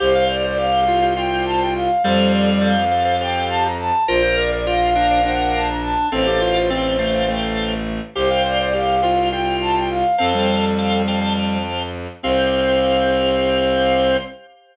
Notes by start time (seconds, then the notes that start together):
0.00 C2 G4 C5 F5
0.14 F5
0.29 C5 D5
0.44 C5 D5
0.58 G4 C5 F5
0.87 F4 G4 C5 F5
1.02 G4 C5 F5
1.16 F4 G4 C5 F5 G5
1.45 A5
1.60 G5
1.75 F5
2.04 F2 G3 G4 A4 C5 F5
2.33 D5
2.48 D5
2.61 G4 A4 C5 F5
2.91 G4 A4 C5 F5
3.05 G4 A4 C5 F5
3.20 G4 A4 C5 F5 G5
3.50 A5
3.64 A#5
3.79 A5
4.08 A#1 F4 A#4 C5 D5 F5
4.22 C5
4.37 A#4 D5
4.51 A#4 D5
4.66 F4 A#4 C5 D5 F5
4.95 D4 A#4 C5 D5 F5
5.10 A#4 C5 D5 F5
5.23 D4 A#4 C5 D5 F5 F#5
5.53 A5
5.68 A#5
5.82 A5
6.12 A1 C4 A4 C5 F5 G5
6.26 G4
6.41 F4
6.55 F4
6.70 C4 A4 C5 F5 G5
6.99 A3 A4 C5 F5 G5
7.14 A4 C5 F5 G5
7.28 A3 A4 C5 F5 G5
8.15 C2 G4 C5 F5 G5
8.30 F5
8.45 C5 D5
8.59 C5 D5
8.73 G4 C5 F5 G5
9.02 F4 C5 F5 G5
9.17 C5 F5 G5
9.32 F4 C5 F5 G5
9.61 A5
9.76 G5
9.90 F5
10.18 F2 C4 A4 C5 F5 G5 A5
10.34 G3
10.78 C5 F5 G5 A5
11.08 C5 F5 G5 A5
11.21 C5 F5 G5 A5
11.36 C5 F5 G5 A5
12.23 C2 C4 G4 C5 F5